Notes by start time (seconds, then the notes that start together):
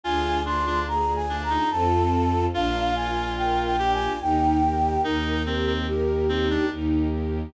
0.03 D2 D4 F4 G#4 G#5
0.45 D4 F4 C6
0.66 D4
0.87 G#4 A#5
1.15 G#5
1.28 D4
1.43 A#5
1.50 D#4
1.70 F2 C4 F4 A4 A5
2.53 A#1 D4 F4 A#4 F5
2.95 F4 G#5
3.37 A#4 G5
3.65 G5
3.79 D4 G4
3.93 G#5
4.20 D#2 D#4 G4 A#4 G5
4.64 G4
5.04 D#2 D#4 G4 A#4
5.46 C4 G4
5.67 C4
5.87 G4 A#4
6.28 C4 D#4
6.50 D4
6.71 D#2 D#4 G4 A#4
7.12 G4